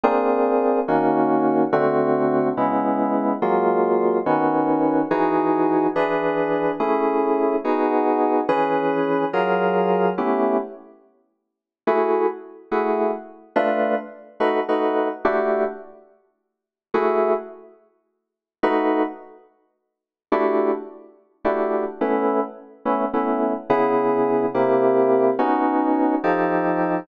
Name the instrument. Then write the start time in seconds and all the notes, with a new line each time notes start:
electric piano 2
0.04 A#3 C4 D4 G#4
0.88 D#3 A#3 C#4 F#4
1.73 D3 A3 C4 F#4
2.57 C#3 G#3 B3 E4
3.42 F#3 G#3 A#3 F4
4.26 D#3 B3 C#4 F#4
5.11 E3 D#4 F#4 G#4
5.96 E3 D4 G#4 B4
6.80 A3 C#4 E4 G#4
7.64 B3 D#4 F#4 G#4
8.49 E3 C#4 G#4 B4
9.33 F#3 F4 G#4 A#4
10.18 A3 B3 C#4 E4 G4
11.87 A3 E4 F#4 G#4
12.71 A3 E4 F#4 G#4
13.56 A3 D4 F4 B4
14.40 A3 D#4 F#4 B4
14.69 A3 D#4 F#4 B4
15.25 A3 D4 E4 F#4 G4
16.94 A3 E4 F#4 G#4
18.63 A3 D#4 F#4 B4
20.32 A3 D4 E4 F#4 G4
21.44 A3 D4 E4 F#4 G4
22.01 A3 B3 C#4 E4
22.85 A3 B3 C#4 E4
23.13 A3 B3 C#4 E4
23.70 C#3 B3 E4 G#4
24.54 C3 A#3 E4 G4
25.39 B3 C#4 D#4 F#4
26.24 F3 D#4 G4 A4